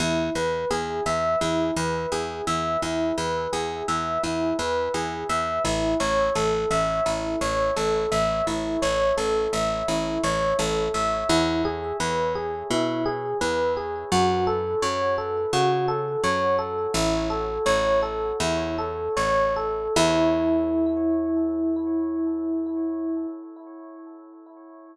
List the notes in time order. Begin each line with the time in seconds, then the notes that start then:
0.00 E2 E4
0.35 E2 B4
0.71 E2 G#4
1.06 E2 E5
1.41 E2 E4
1.76 E2 B4
2.12 E2 G#4
2.47 E2 E5
2.82 E2 E4
3.18 E2 B4
3.53 E2 G#4
3.88 E2 E5
4.23 E2 E4
4.59 E2 B4
4.94 E2 G#4
5.29 E2 E5
5.65 A1 E4
6.00 A1 C#5
6.35 A1 A4
6.71 A1 E5
7.06 A1 E4
7.41 A1 C#5
7.76 A1 A4
8.12 A1 E5
8.47 A1 E4
8.82 A1 C#5
9.17 A1 A4
9.53 A1 E5
9.88 A1 E4
10.24 A1 C#5
10.59 A1 A4
10.94 A1 E5
11.29 E2 E4
11.65 G#4
12.00 E2 B4
12.35 G#4
12.70 B2 E4
13.06 G#4
13.41 E2 B4
13.77 G#4
14.12 F#2 F#4
14.47 A4
14.82 F#2 C#5
15.18 A4
15.53 C#3 F#4
15.88 A4
16.24 F#2 C#5
16.59 A4
16.94 A1 E4
17.30 A4
17.66 A1 C#5
18.02 A4
18.40 E2 E4
18.78 A4
19.17 A1 C#5
19.56 A4
19.96 E2 E4